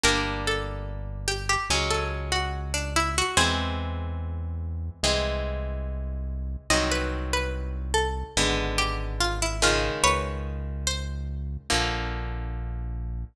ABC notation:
X:1
M:4/4
L:1/16
Q:1/4=72
K:Flyd
V:1 name="Pizzicato Strings"
_B2 A4 G G z A z _G2 D E G | [^G^B]8 z8 | _e B2 B2 z A3 z G2 F =E F2 | [B_d]4 c8 z4 |]
V:2 name="Orchestral Harp"
[G,_B,D]8 [_G,_A,_D]8 | [E,^G,^B,]8 [E,G,C]8 | [_E,_G,C]8 [D,_A,_C]6 [_D,E,A,]2- | [_D,_E,_A,]8 [=D,F,_B,]8 |]
V:3 name="Synth Bass 1" clef=bass
G,,,8 _D,,8 | E,,8 C,,8 | C,,8 _A,,,8 | _D,,8 _B,,,8 |]